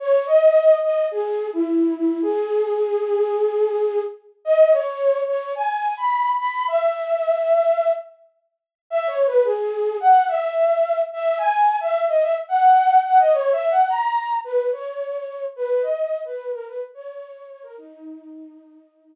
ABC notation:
X:1
M:4/4
L:1/16
Q:1/4=108
K:C#dor
V:1 name="Flute"
c2 d4 d2 G3 E3 E2 | G16 | d2 c4 c2 g3 b3 b2 | e10 z6 |
(3e2 c2 B2 G4 f2 e6 | e2 g3 e2 d e z f4 f d | (3c2 e2 f2 a4 B2 c6 | B2 d3 B2 A B z c4 c A |
D14 z2 |]